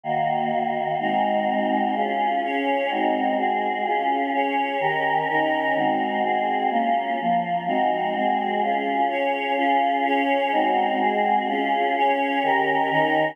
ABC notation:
X:1
M:2/2
L:1/8
Q:1/2=63
K:Db
V:1 name="Choir Aahs"
[E,B,G]4 [A,CEG]4 | [DFA]2 [DAd]2 [A,CEG]2 [A,CGA]2 | [DFA]2 [DAd]2 [E,D=GB]2 [E,DEB]2 | [A,CEG]2 [A,CGA]2 [B,DF]2 [F,B,F]2 |
[A,CEG]2 [A,CGA]2 [DFA]2 [DAd]2 | [DFA]2 [DAd]2 [A,CEG]2 [A,CGA]2 | [DFA]2 [DAd]2 [E,D=GB]2 [E,DEB]2 |]